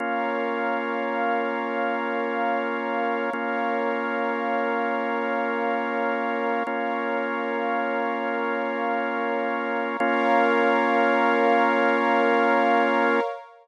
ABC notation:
X:1
M:3/4
L:1/8
Q:1/4=54
K:Bbm
V:1 name="Drawbar Organ"
[B,DF]6 | [B,DF]6 | [B,DF]6 | [B,DF]6 |]
V:2 name="Pad 2 (warm)"
[Bdf]6 | [Bdf]6 | [Bdf]6 | [Bdf]6 |]